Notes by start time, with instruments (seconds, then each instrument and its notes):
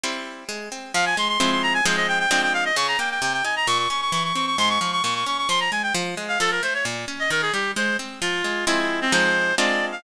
0.04 orchestral harp G3 C4 E4
0.49 orchestral harp G#3
0.72 orchestral harp C4
0.94 orchestral harp F3, clarinet F5
1.06 clarinet G#5
1.17 orchestral harp G#3, clarinet C6
1.28 clarinet C6
1.40 orchestral harp F3 G#3 C4 E4, clarinet C6
1.51 clarinet C6
1.63 clarinet A#5
1.74 clarinet G#5
1.86 orchestral harp F3 G#3 C4 D#4, clarinet C5
1.96 clarinet D#5
2.08 clarinet G5
2.19 clarinet G5
2.31 orchestral harp F3 G#3 C4 D4, clarinet G5
2.42 clarinet G5
2.54 clarinet F5
2.65 clarinet D#5
2.76 orchestral harp C#3, clarinet C#6
2.88 clarinet A#5
2.99 orchestral harp A#3, clarinet G5
3.11 clarinet G5
3.22 orchestral harp C3, clarinet G5
3.33 clarinet G5
3.44 orchestral harp D#4, clarinet G#5
3.56 clarinet A#5
3.67 orchestral harp A#2, clarinet C#6
3.79 clarinet C#6
3.90 orchestral harp C#4, clarinet C#6
4.01 clarinet C#6
4.12 orchestral harp E3, clarinet C#6
4.24 clarinet C#6
4.35 orchestral harp C4, clarinet C#6
4.46 clarinet C#6
4.58 orchestral harp G#2, clarinet C6
4.69 clarinet C#6
4.80 orchestral harp F3, clarinet C#6
4.92 clarinet C#6
5.03 orchestral harp A#2, clarinet C#6
5.15 clarinet C#6
5.26 orchestral harp C#4, clarinet C#6
5.38 clarinet C#6
5.49 orchestral harp F3, clarinet C6
5.60 clarinet A#5
5.71 orchestral harp G#3, clarinet G#5
5.83 clarinet G5
5.94 orchestral harp F3
6.17 orchestral harp G#3
6.28 clarinet F5
6.40 orchestral harp F3, clarinet A4
6.51 clarinet A#4
6.63 orchestral harp A3, clarinet C5
6.74 clarinet C#5
6.85 orchestral harp A#2
7.08 orchestral harp C#4
7.20 clarinet D#5
7.30 orchestral harp D#3, clarinet A#4
7.42 clarinet G#4
7.53 orchestral harp G3, clarinet G4
7.76 orchestral harp G#3, clarinet C5
7.99 orchestral harp C4
8.21 orchestral harp F3, clarinet F4
8.44 orchestral harp G#3
8.67 orchestral harp F3 G#3 C4 E4, clarinet E4
9.01 clarinet C4
9.12 orchestral harp F3 G#3 C4 D#4, clarinet C5
9.58 orchestral harp G#3 C4 D4 F4, clarinet D5
9.92 clarinet F5